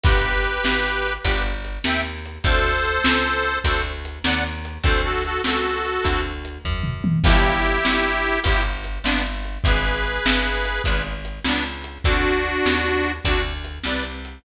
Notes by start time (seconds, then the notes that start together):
0.04 G1 B3 D4 F4 G4 B4, kick, closed hi-hat
0.44 closed hi-hat
0.64 G#1, snare
1.05 closed hi-hat
1.24 G1 B3 D4 F4 G4 B4, kick, closed hi-hat
1.65 closed hi-hat
1.84 D#2 E5 G5, snare
2.25 closed hi-hat
2.44 D2 A3 C4 D4 F#4 A4 C5, kick, closed hi-hat
2.85 closed hi-hat
3.04 C#2, snare
3.44 closed hi-hat
3.64 D2 A3 C4 D4 F#4 A4 C5, kick, closed hi-hat
4.05 closed hi-hat
4.24 D#2 D5 F#5, snare
4.65 closed hi-hat
4.83 D2 A3 C4 D4 F#4 A4 C5, kick, closed hi-hat
5.04 F#4 A4
5.25 F#4 A4, closed hi-hat
5.44 C#2 F#4 A4, snare
5.85 closed hi-hat
6.04 D2 A3 C4 D4 F#4, kick, closed hi-hat
6.45 closed hi-hat
6.65 F#2, kick, floor tom
6.84 mid tom
7.04 high tom
7.24 G1 B3 D4 E4 F4 G4, kick, crash
7.64 closed hi-hat
7.85 G1, snare
8.25 closed hi-hat
8.44 G1 B3 D4 E4 F4 G4, kick, closed hi-hat
8.84 closed hi-hat
9.04 G1 B3 D4, snare
9.45 closed hi-hat
9.64 G#1 B3 D4 F4 G#4 B4, kick, closed hi-hat
10.04 closed hi-hat
10.25 G1, snare
10.65 closed hi-hat
10.84 G#1 B3 D4 F4 G#4 B4, kick, closed hi-hat
11.25 closed hi-hat
11.44 C#2 B3 D4, snare
11.84 closed hi-hat
12.04 D2 C4 D4 F#4 A4, kick, closed hi-hat
12.45 closed hi-hat
12.65 D#2, snare
13.05 closed hi-hat
13.25 D2 C4 D4 F#4 A4, kick, closed hi-hat
13.64 closed hi-hat
13.84 C2 B4 D5, snare
14.25 closed hi-hat